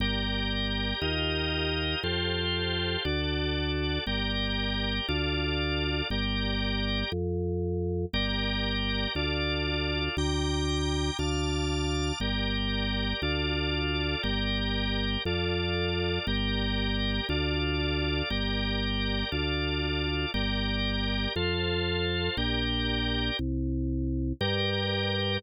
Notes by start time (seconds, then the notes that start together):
0.00 G1 G4 A#4 D5
1.02 D#2 F4 G4 A#4 D#5
2.03 F2 F4 G4 A4 C5
3.05 D2 F#4 A4 D5
4.07 G1 G4 A#4 D5
5.08 D2 F4 A4 D5
6.10 G1 G4 A#4 D5
7.12 F2
8.13 G1 G4 A#4 D5
9.15 D2 F4 A4 D5
10.17 D2 G5 A#5 D6
11.19 D2 F5 A5 D6
12.20 G1 G4 A#4 D5
13.22 D2 F4 A4 D5
14.23 G1 G4 A#4 D5
15.25 F2 F4 A4 D5
16.27 G1 G4 A#4 D5
17.29 D2 F4 A4 D5
18.30 G1 G4 A#4 D5
19.32 D2 F4 A4 D5
20.34 G1 G4 A#4 D5
21.36 F2 F4 A4 C5
22.37 A#1 G4 A#4 D5
23.39 C2
24.41 G2 G4 A#4 D5